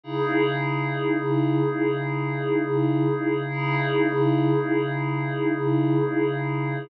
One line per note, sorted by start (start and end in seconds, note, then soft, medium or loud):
0.04 3.43 C#3 medium
0.04 3.43 D#4 medium
0.04 3.43 E4 medium
0.04 3.43 G#4 medium
3.48 6.87 C#3 medium
3.48 6.87 D#4 medium
3.48 6.87 E4 medium
3.48 6.87 G#4 medium